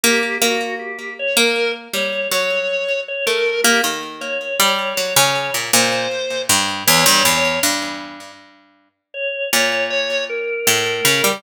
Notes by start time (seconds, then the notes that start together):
0.03 A#3 G4
0.41 A#3 F#4
0.79 G4
1.19 C#5
1.37 A#3 A#4
1.93 G3 C#5
2.31 F#3 C#5
3.08 C#5
3.26 A3 A#4
3.64 A#3 G4
3.84 D#3
4.21 C#5
4.59 G3
4.97 F#3
5.16 C#3
5.54 A#2
5.73 A#2 C5
6.49 G2
6.87 E2 C#5
7.06 G2
7.13 C#5
7.25 E2
7.37 C#5
7.63 G2
9.14 C#5
9.53 A#2 C#5
9.90 C#5
10.29 A#4
10.67 A2
11.05 C#3
11.24 G3